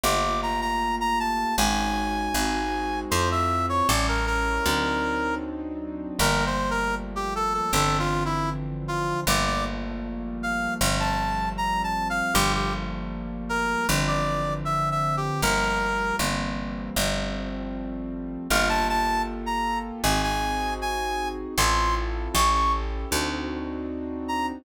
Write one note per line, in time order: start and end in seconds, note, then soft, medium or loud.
0.03 1.45 G1 loud
0.03 1.54 A3 loud
0.03 1.54 A#3 medium
0.03 1.54 F4 loud
0.03 1.54 G4 medium
0.03 0.40 D6 loud
0.42 0.61 A#5 medium
0.61 0.96 A#5 medium
1.00 1.19 A#5 loud
1.20 1.56 A5 medium
1.58 2.29 G#1 loud
1.58 2.33 G#3 medium
1.58 2.33 C#4 medium
1.58 2.33 D#4 medium
1.58 2.33 F#4 medium
1.58 3.00 G#5 medium
2.34 3.05 G#1 loud
2.34 3.10 G#3 loud
2.34 3.10 C4 medium
2.34 3.10 D#4 medium
2.34 3.10 F#4 loud
3.11 3.82 F2 loud
3.11 3.87 A3 loud
3.11 3.87 C4 loud
3.11 3.87 E4 loud
3.11 3.87 F4 loud
3.11 3.29 C5 medium
3.31 3.66 E5 medium
3.69 3.87 C#5 medium
3.88 4.60 A1 loud
3.88 4.65 G3 medium
3.88 4.65 A3 medium
3.88 4.65 C#4 loud
3.88 4.65 E4 loud
3.88 4.07 D5 medium
4.08 4.26 A#4 medium
4.26 5.35 A#4 medium
4.66 6.07 D2 medium
4.66 6.16 F#3 medium
4.66 6.16 C4 loud
4.66 6.16 D4 medium
4.66 6.16 D#4 medium
6.19 7.61 G1 loud
6.19 7.69 F3 loud
6.19 7.69 G3 medium
6.19 7.69 A3 medium
6.19 7.69 A#3 loud
6.19 6.44 A#4 medium
6.46 6.70 C5 medium
6.70 6.95 A#4 medium
7.16 7.34 G4 medium
7.35 7.53 A4 medium
7.54 7.72 A4 medium
7.73 9.14 G1 loud
7.73 9.24 D3 medium
7.73 9.24 E3 medium
7.73 9.24 F3 medium
7.73 9.24 C4 medium
7.73 7.97 A4 medium
7.99 8.23 F4 medium
8.25 8.50 E4 medium
8.88 9.20 F4 medium
9.27 10.68 G1 loud
9.27 10.78 F3 loud
9.27 10.78 G3 medium
9.27 10.78 A3 loud
9.27 10.78 A#3 loud
9.27 9.46 D5 medium
9.46 9.64 D5 medium
10.43 10.74 F5 medium
10.81 12.22 G1 loud
10.81 12.32 F3 loud
10.81 12.32 G3 loud
10.81 12.32 A3 medium
10.81 12.32 C4 loud
11.00 11.49 A5 medium
11.57 11.82 A#5 medium
11.83 12.08 A5 medium
12.10 12.34 F5 medium
12.34 13.76 G1 loud
12.34 13.85 F3 medium
12.34 13.85 G3 medium
12.34 13.85 A3 loud
12.34 13.85 A#3 medium
12.34 12.52 G4 loud
12.55 12.73 G4 medium
13.49 13.87 A#4 loud
13.89 15.30 G1 loud
13.89 15.40 D3 loud
13.89 15.40 E3 loud
13.89 15.40 F3 loud
13.89 15.40 C4 medium
14.07 14.54 D5 medium
14.65 14.89 E5 medium
14.91 15.16 E5 medium
15.17 15.41 G4 medium
15.42 16.13 G1 loud
15.42 16.18 F3 medium
15.42 16.18 G3 loud
15.42 16.18 A3 medium
15.42 16.18 A#3 loud
15.42 16.16 A#4 loud
16.19 16.90 G1 medium
16.19 16.95 E3 loud
16.19 16.95 G3 loud
16.19 16.95 A#3 loud
16.19 16.95 C4 loud
16.96 18.38 G1 loud
16.96 18.47 F3 medium
16.96 18.47 G3 medium
16.96 18.47 A3 medium
16.96 18.47 C4 medium
18.50 19.92 G1 loud
18.50 20.01 A#3 medium
18.50 20.01 F4 loud
18.50 20.01 G4 medium
18.50 20.01 A4 loud
18.50 18.68 F5 loud
18.69 18.87 A5 loud
18.89 19.22 A5 loud
19.46 19.79 A#5 medium
20.03 21.45 G#1 loud
20.03 21.54 C4 medium
20.03 21.54 D#4 medium
20.03 21.54 F#4 loud
20.03 21.54 G#4 loud
20.03 20.21 G#5 medium
20.23 20.74 G#5 medium
20.81 21.28 G#5 medium
21.58 22.28 A1 loud
21.58 22.34 C4 medium
21.58 22.33 E4 loud
21.58 22.34 F4 medium
21.58 22.33 A4 loud
21.58 21.95 C6 loud
22.34 23.05 A1 loud
22.34 23.09 C#4 medium
22.34 23.09 E4 medium
22.34 23.09 G4 loud
22.34 23.09 A4 loud
22.34 22.53 C#6 loud
22.54 22.72 C#6 medium
23.11 24.53 D2 loud
23.11 24.62 C4 loud
23.11 24.62 D4 loud
23.11 24.62 D#4 loud
23.11 24.62 F#4 medium
24.28 24.46 A#5 medium